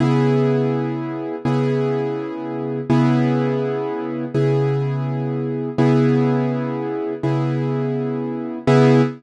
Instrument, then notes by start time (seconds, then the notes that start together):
acoustic grand piano
0.00 C#3 B3 E4 G#4
1.45 C#3 B3 E4 G#4
2.90 C#3 B3 E4 G#4
4.34 C#3 B3 E4 G#4
5.78 C#3 B3 E4 G#4
7.23 C#3 B3 E4 G#4
8.67 C#3 B3 E4 G#4